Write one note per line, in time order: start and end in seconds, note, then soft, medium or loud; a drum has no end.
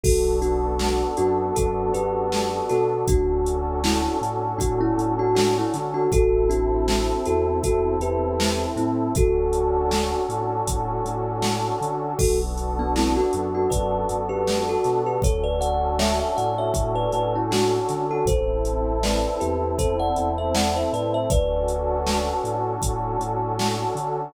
0.03 1.02 B1 medium
0.03 3.02 B3 medium
0.03 3.02 D4 medium
0.03 0.37 F#4 medium
0.03 3.02 F#4 medium
0.03 0.37 A4 medium
0.03 3.02 A4 medium
0.03 kick medium
0.03 crash medium
0.42 1.15 D4 medium
0.42 1.15 F#4 medium
0.42 closed hi-hat medium
0.79 snare medium
1.17 1.51 F#2 medium
1.17 1.54 D4 medium
1.17 1.54 F#4 medium
1.17 closed hi-hat medium
1.56 1.90 F#2 medium
1.56 1.90 F#4 medium
1.56 1.90 A4 medium
1.56 kick medium
1.56 closed hi-hat medium
1.94 2.61 F#2 medium
1.94 2.66 G4 medium
1.94 2.66 B4 medium
1.94 closed hi-hat medium
2.32 snare medium
2.69 3.03 B2 medium
2.69 3.06 F#4 medium
2.69 3.06 A4 medium
2.69 snare soft
2.69 closed hi-hat medium
3.08 4.07 D2 medium
3.08 6.08 C#4 medium
3.08 3.78 D4 medium
3.08 6.08 D4 medium
3.08 3.78 F#4 medium
3.08 6.08 F#4 medium
3.08 6.08 A4 medium
3.08 kick medium
3.08 closed hi-hat medium
3.46 closed hi-hat medium
3.84 4.16 C#4 medium
3.84 4.16 E4 medium
3.84 snare loud
4.21 4.54 A2 medium
4.21 closed hi-hat medium
4.58 4.91 A2 medium
4.58 4.79 D4 medium
4.58 4.79 F#4 medium
4.58 kick medium
4.58 closed hi-hat medium
4.81 5.14 C#4 medium
4.81 5.14 E4 medium
4.98 5.64 A2 medium
4.98 closed hi-hat medium
5.19 5.35 D4 medium
5.19 5.35 F#4 medium
5.35 5.55 D4 medium
5.35 5.55 F#4 medium
5.35 snare loud
5.58 5.74 C#4 medium
5.58 5.74 E4 medium
5.73 6.07 D3 medium
5.73 snare soft
5.73 closed hi-hat medium
5.94 6.10 D4 medium
5.94 6.10 F#4 medium
6.12 7.11 A1 medium
6.12 9.11 C4 medium
6.12 9.11 E4 medium
6.12 6.49 F#4 medium
6.12 6.49 A4 loud
6.12 9.11 A4 medium
6.12 kick medium
6.12 closed hi-hat medium
6.50 7.22 D4 medium
6.50 7.22 F#4 medium
6.50 closed hi-hat medium
6.88 snare medium
7.25 7.60 E2 medium
7.25 7.58 F#4 medium
7.25 7.58 A4 medium
7.25 closed hi-hat medium
7.63 7.96 E2 medium
7.63 7.95 F#4 medium
7.63 7.95 A4 medium
7.63 kick medium
7.63 closed hi-hat medium
8.00 8.66 E2 medium
8.00 8.65 G4 medium
8.00 8.65 B4 medium
8.00 closed hi-hat medium
8.40 snare loud
8.76 9.09 A2 medium
8.76 9.12 C4 medium
8.76 9.12 E4 medium
8.76 closed hi-hat medium
9.15 10.14 D2 medium
9.15 12.14 C#4 medium
9.15 12.14 D4 medium
9.15 12.14 F#4 medium
9.15 10.21 F#4 medium
9.15 12.14 A4 medium
9.15 10.21 A4 medium
9.15 kick medium
9.15 closed hi-hat medium
9.53 closed hi-hat medium
9.91 snare medium
10.29 10.62 A2 medium
10.29 closed hi-hat medium
10.67 11.00 A2 medium
10.67 kick medium
10.67 closed hi-hat loud
11.05 11.71 A2 medium
11.05 closed hi-hat medium
11.42 snare medium
11.81 12.14 D3 medium
11.81 closed hi-hat medium
12.19 13.17 B1 medium
12.19 15.18 B3 medium
12.19 15.18 D4 medium
12.19 12.39 F#4 medium
12.19 15.18 F#4 medium
12.19 12.39 A4 medium
12.19 15.18 A4 medium
12.19 kick medium
12.19 crash medium
12.57 closed hi-hat medium
12.79 12.95 B3 medium
12.79 12.95 D4 medium
12.96 13.16 C4 medium
12.96 13.16 E4 medium
12.96 snare medium
13.16 13.52 D4 medium
13.16 13.52 F#4 medium
13.33 13.67 F#2 medium
13.33 closed hi-hat medium
13.55 13.70 D4 medium
13.55 13.70 F#4 medium
13.70 14.04 F#2 medium
13.70 14.19 B4 medium
13.70 14.19 D5 medium
13.70 kick medium
13.70 closed hi-hat medium
14.09 14.76 F#2 medium
14.09 closed hi-hat medium
14.29 14.62 G4 medium
14.29 14.62 B4 medium
14.47 snare medium
14.69 15.01 F#4 medium
14.69 15.01 A4 medium
14.84 15.18 B2 medium
14.84 snare soft
14.84 closed hi-hat medium
15.06 15.22 G4 medium
15.06 15.22 B4 medium
15.22 16.22 D2 medium
15.22 18.21 C#4 medium
15.22 18.21 D4 medium
15.22 18.21 F#4 medium
15.22 18.21 A4 medium
15.22 15.44 A4 medium
15.22 15.44 C#5 medium
15.22 kick medium
15.22 closed hi-hat medium
15.44 15.59 B4 medium
15.44 15.59 D5 medium
15.61 15.98 D5 medium
15.61 15.98 F#5 medium
15.61 closed hi-hat medium
15.99 16.19 C#5 medium
15.99 16.19 E5 medium
15.99 snare loud
16.19 16.35 C#5 medium
16.19 16.35 E5 medium
16.37 16.71 A2 medium
16.37 16.57 D5 medium
16.37 16.57 F#5 medium
16.37 closed hi-hat medium
16.58 16.92 C#5 medium
16.58 16.92 E5 medium
16.73 17.06 A2 medium
16.73 kick medium
16.73 closed hi-hat medium
16.95 17.11 B4 medium
16.95 17.11 D5 medium
17.12 17.79 A2 medium
17.12 17.34 B4 medium
17.12 17.34 D5 medium
17.12 closed hi-hat medium
17.35 17.51 C#4 medium
17.35 17.51 E4 medium
17.51 18.05 D4 medium
17.51 18.05 F#4 medium
17.51 snare loud
17.89 18.22 D3 medium
17.89 snare soft
17.89 closed hi-hat medium
18.11 18.27 F#4 medium
18.11 18.27 A4 medium
18.25 19.24 A1 medium
18.25 21.25 C4 medium
18.25 21.25 E4 medium
18.25 21.25 A4 medium
18.25 18.99 A4 medium
18.25 18.99 C5 medium
18.25 kick medium
18.25 closed hi-hat medium
18.65 closed hi-hat medium
19.03 19.37 B4 medium
19.03 19.37 D5 medium
19.03 snare medium
19.40 19.75 E2 medium
19.40 19.77 G4 medium
19.40 19.77 B4 medium
19.40 closed hi-hat medium
19.78 20.11 E2 medium
19.78 19.99 A4 medium
19.78 19.99 C5 medium
19.78 kick medium
19.78 closed hi-hat medium
20.00 20.31 D5 medium
20.00 20.31 F#5 medium
20.16 20.83 E2 medium
20.16 closed hi-hat medium
20.38 20.54 C5 medium
20.38 20.54 E5 medium
20.55 20.75 D5 medium
20.55 20.75 F#5 medium
20.55 snare loud
20.76 20.92 C5 medium
20.76 20.92 E5 medium
20.93 21.25 A2 medium
20.93 21.14 B4 medium
20.93 21.14 D5 medium
20.93 closed hi-hat medium
21.14 21.30 C5 medium
21.14 21.30 E5 medium
21.30 22.31 D2 medium
21.30 24.28 C#4 medium
21.30 24.28 D4 medium
21.30 24.28 F#4 medium
21.30 24.28 A4 medium
21.30 22.65 B4 medium
21.30 22.65 D5 medium
21.30 kick medium
21.30 closed hi-hat medium
21.68 closed hi-hat medium
22.06 snare medium
22.44 22.77 A2 medium
22.44 closed hi-hat medium
22.82 23.16 A2 medium
22.82 kick medium
22.82 closed hi-hat loud
23.19 23.85 A2 medium
23.19 closed hi-hat medium
23.59 snare medium
23.95 24.28 D3 medium
23.95 closed hi-hat medium